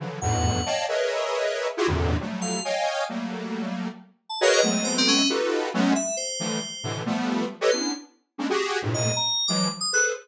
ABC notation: X:1
M:6/4
L:1/16
Q:1/4=136
K:none
V:1 name="Lead 1 (square)"
[^C,D,E,F,^F,]2 [E,,=F,,G,,^G,,A,,B,,]4 [^cd^df=ga]2 [^G^ABcde]8 [EF^F=G^G] [E,,^F,,G,,^A,,=C,=D,]3 [=F,^F,=G,=A,]4 | [^c^dfg^g]4 [^F,=G,A,^A,]8 z4 [^F^G^ABcd]2 [F,^G,=A,B,=C]6 | [^DF^FGAB]4 [^F,^G,A,B,^C]2 z4 [=D,E,=F,=G,A,]2 z2 [A,,B,,=C,D,E,]2 [F,G,A,B,]4 z [GAB^c^d] [B,C=DE]2 | z4 [G,^G,^A,C^CD] [^F=G^G]3 [=G,,=A,,^A,,=C,]3 z3 [E,=F,^F,^G,]2 z2 [G=ABc]2 z4 |]
V:2 name="Electric Piano 2"
z2 ^f6 z14 =f2 | z15 a f ^G ^d2 c C ^C2 | z6 e2 c8 z6 c'2 | z9 ^d2 ^a3 =d'2 z ^d' ^f' z5 |]